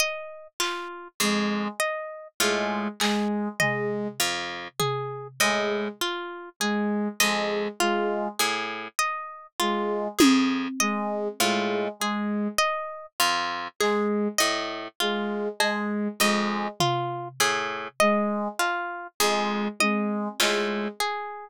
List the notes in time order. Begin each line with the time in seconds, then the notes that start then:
0.00 D#5
0.60 F4, clap
1.20 F2 G#3 G#4
1.80 D#5
2.40 A2 G#3 F4
3.00 G#3 G#4, clap
3.60 G#3 D#5, floor tom
4.20 F2 F4
4.79 G#4, floor tom
5.40 A2 G#3 D#5
6.01 F4
6.60 G#3 G#4
7.20 F2 G#3 D#5
7.80 G#3 F4
8.39 A2 G#4
8.99 D#5
9.60 G#3 F4
10.19 F2 G#4, high tom
10.80 G#3 D#5
11.40 A2 G#3 F4
12.00 G#3 G#4
12.58 D#5
13.20 F2 F4
13.80 G#3 G#4, clap
14.38 A2 D#5
15.00 G#3 F4
15.60 G#3 G#4, cowbell
16.20 F2 G#3 D#5
16.80 F4, floor tom
17.40 A2 G#4
18.00 G#3 D#5
18.59 F4, cowbell
19.20 F2 G#3 G#4
19.80 G#3 D#5, high tom
20.40 A2 G#3 F4, clap
21.00 G#4